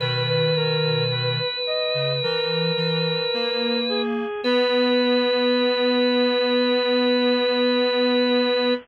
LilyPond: <<
  \new Staff \with { instrumentName = "Drawbar Organ" } { \time 4/4 \key b \major \tempo 4 = 54 b'1 | b'1 | }
  \new Staff \with { instrumentName = "Lead 1 (square)" } { \time 4/4 \key b \major b'16 b'16 ais'8 b'8 dis''8 ais'4. gis'8 | b'1 | }
  \new Staff \with { instrumentName = "Clarinet" } { \time 4/4 \key b \major <b, dis>4. r16 cis16 e8 e8 ais4 | b1 | }
>>